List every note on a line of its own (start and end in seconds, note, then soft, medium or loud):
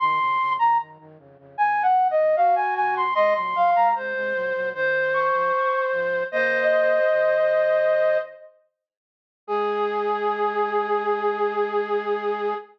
0.00 0.19 F#2 loud
0.00 0.19 D#3 loud
0.00 0.53 C6 loud
0.20 0.38 F2 medium
0.20 0.38 C#3 loud
0.39 0.58 F2 medium
0.39 0.58 C#3 medium
0.59 0.78 F#2 medium
0.59 0.78 D#3 medium
0.59 0.78 A#5 medium
0.79 0.98 F#2 medium
0.79 0.98 D#3 medium
0.99 1.18 F#2 medium
0.99 1.18 D#3 medium
1.18 1.37 F2 medium
1.18 1.37 C#3 medium
1.38 1.57 F2 medium
1.38 1.57 C#3 medium
1.58 2.15 D#2 medium
1.58 2.15 C3 medium
1.58 1.83 G#5 medium
1.83 2.08 F#5 medium
2.11 2.36 D#5 medium
2.17 2.36 D#2 medium
2.17 2.36 C3 medium
2.36 3.04 F#4 medium
2.36 2.55 F5 medium
2.56 2.74 G#5 medium
2.76 3.15 D#2 medium
2.76 3.15 C3 medium
2.76 2.95 G#5 medium
2.97 3.14 C6 medium
3.15 3.34 C3 medium
3.15 3.34 G#3 medium
3.15 3.34 D#5 loud
3.15 3.33 C6 medium
3.35 3.54 A#2 medium
3.35 3.54 F#3 loud
3.35 3.71 C6 medium
3.55 3.74 A#2 medium
3.55 3.74 F#3 medium
3.55 3.88 F5 medium
3.75 3.94 C3 medium
3.75 3.94 G#3 medium
3.75 3.95 A#5 medium
3.95 4.14 C3 medium
3.95 4.14 G#3 medium
3.95 4.69 C5 medium
4.14 4.33 C3 medium
4.14 4.33 G#3 medium
4.34 4.53 A#2 medium
4.34 4.53 F#3 medium
4.54 4.73 A#2 medium
4.54 4.73 F#3 medium
4.74 5.31 F#2 medium
4.74 5.31 D#3 loud
4.74 6.23 C5 medium
5.14 5.82 C#6 medium
5.33 5.51 G#2 medium
5.33 5.51 F3 medium
5.92 6.24 G#2 medium
5.92 6.24 F3 medium
6.32 7.00 C#3 medium
6.32 7.00 A#3 loud
6.32 8.18 C5 medium
6.32 6.63 D#5 medium
6.32 8.18 D#5 medium
6.72 7.39 C5 medium
7.10 8.18 F#2 medium
7.10 8.18 D#3 medium
9.47 12.54 G#3 loud
9.47 12.54 G#4 loud